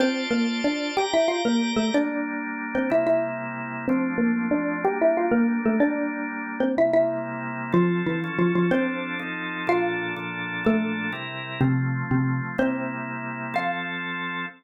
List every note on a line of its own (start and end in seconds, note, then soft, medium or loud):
0.00 0.26 C4 medium
0.00 0.96 F4 medium
0.00 0.26 C5 loud
0.00 0.96 C5 medium
0.00 0.96 D5 medium
0.00 0.96 A5 medium
0.31 0.61 A#3 medium
0.31 0.61 A#4 medium
0.64 0.91 D4 medium
0.64 0.91 D5 medium
0.97 1.10 G4 medium
0.97 1.94 G4 medium
0.97 1.94 D5 medium
0.97 1.10 G5 medium
0.97 1.94 A#5 medium
1.13 1.28 E4 medium
1.13 1.28 E5 medium
1.28 1.42 F4 medium
1.28 1.42 F5 medium
1.45 1.72 A#3 medium
1.45 1.72 A#4 medium
1.76 1.90 A3 medium
1.76 1.90 A4 medium
1.94 2.89 G3 medium
1.94 2.89 A#3 medium
1.94 2.67 D4 medium
1.94 2.90 D4 medium
1.94 2.67 D5 medium
2.75 2.90 C4 medium
2.75 2.90 C5 medium
2.90 3.86 C3 medium
2.90 3.86 G3 medium
2.90 3.86 A#3 medium
2.90 3.86 E4 medium
2.90 3.05 E4 medium
2.90 3.05 E5 medium
3.07 3.65 E4 medium
3.07 3.65 E5 medium
3.88 4.85 F3 loud
3.88 4.85 A3 medium
3.88 4.14 C4 loud
3.88 4.85 C4 medium
3.88 4.84 D4 medium
3.88 4.14 C5 loud
4.18 4.48 A#3 medium
4.18 4.48 A#4 medium
4.51 4.77 D4 medium
4.51 4.77 D5 medium
4.84 5.80 G3 loud
4.84 5.80 A#3 medium
4.84 5.80 D4 medium
4.84 4.98 G4 medium
4.84 4.98 G5 loud
5.01 5.16 E4 medium
5.01 5.16 E5 loud
5.17 5.32 F4 medium
5.17 5.32 F5 medium
5.31 5.58 A#3 medium
5.31 5.58 A#4 loud
5.65 5.79 A3 medium
5.65 5.79 A4 loud
5.80 6.76 G3 medium
5.80 6.76 A#3 medium
5.80 6.53 D4 loud
5.80 6.78 D4 medium
5.80 6.53 D5 loud
6.60 6.75 C4 medium
6.60 6.75 C5 medium
6.77 7.72 C3 medium
6.77 7.72 G3 medium
6.77 7.72 A#3 medium
6.77 7.72 E4 medium
6.77 6.91 E4 medium
6.77 6.91 E5 medium
6.93 7.51 E4 medium
6.93 7.51 E5 loud
7.72 8.20 F3 medium
7.72 8.02 F3 loud
7.72 8.20 C4 medium
7.72 8.02 F4 loud
7.72 8.20 A4 medium
8.06 8.34 E3 medium
8.06 8.34 E4 medium
8.24 8.71 F3 medium
8.24 8.72 C#4 medium
8.24 8.71 A4 medium
8.39 8.52 F3 medium
8.39 8.52 F4 medium
8.55 8.70 F3 medium
8.55 8.70 F4 medium
8.71 9.19 F3 medium
8.71 9.25 C4 loud
8.71 9.19 C4 loud
8.71 9.20 D4 medium
8.71 9.19 A4 medium
8.71 9.25 C5 loud
9.19 9.67 F3 medium
9.19 9.67 C4 medium
9.19 9.67 D#4 medium
9.19 9.67 A4 medium
9.67 10.15 A#2 medium
9.67 10.15 F3 medium
9.67 10.15 D4 medium
9.67 10.25 F4 medium
9.67 10.15 A4 loud
9.67 10.25 F5 loud
10.16 10.64 A#2 medium
10.16 10.64 F3 medium
10.16 10.64 D4 medium
10.16 10.64 A4 medium
10.65 11.12 A#2 medium
10.65 11.12 F3 medium
10.65 11.11 A3 medium
10.65 11.12 D4 medium
10.65 11.12 A4 medium
10.65 11.11 A4 loud
11.12 11.60 C3 medium
11.12 11.60 G3 medium
11.12 11.60 E4 medium
11.12 11.60 A#4 medium
11.61 12.03 C3 medium
11.61 12.57 F3 medium
11.61 12.57 A3 medium
11.61 12.03 C4 loud
11.61 12.57 C4 medium
12.11 12.41 C3 medium
12.11 12.41 C4 medium
12.58 13.54 C3 medium
12.58 13.54 G3 medium
12.58 13.54 A#3 medium
12.58 13.18 C4 medium
12.58 13.54 E4 medium
12.58 13.18 C5 loud
13.54 14.46 F3 loud
13.54 14.46 C4 loud
13.54 14.46 A4 loud
13.54 14.48 F5 loud